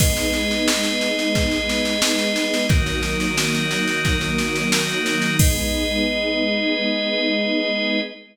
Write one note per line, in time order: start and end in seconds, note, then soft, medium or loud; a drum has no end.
0.00 2.68 G#3 loud
0.00 2.68 B3 loud
0.00 2.68 D#4 medium
0.00 2.67 G#4 loud
0.00 2.67 B4 loud
0.00 2.67 D#5 loud
0.00 kick medium
0.00 snare medium
0.00 crash medium
0.17 snare medium
0.33 snare medium
0.51 snare medium
0.68 snare loud
0.84 snare medium
1.01 snare medium
1.19 snare medium
1.35 kick medium
1.35 snare medium
1.51 snare medium
1.69 snare medium
1.85 snare medium
2.02 snare loud
2.19 snare medium
2.36 snare medium
2.54 snare medium
2.69 5.37 D#3 medium
2.69 5.37 F#3 medium
2.69 5.37 A#3 loud
2.69 5.37 D#4 loud
2.69 5.37 F#4 loud
2.69 5.37 A#4 loud
2.69 kick loud
2.69 snare medium
2.86 snare medium
3.03 snare medium
3.20 snare medium
3.37 snare medium
3.54 snare medium
3.71 snare medium
3.87 snare medium
4.05 kick medium
4.05 snare medium
4.21 snare medium
4.38 snare medium
4.56 snare medium
4.72 snare loud
4.89 snare medium
5.06 snare medium
5.22 snare medium
5.39 8.00 G#3 loud
5.39 8.00 B3 loud
5.39 8.00 D#4 medium
5.39 8.00 G#4 loud
5.39 8.00 B4 loud
5.39 8.00 D#5 loud
5.39 kick loud
5.39 crash loud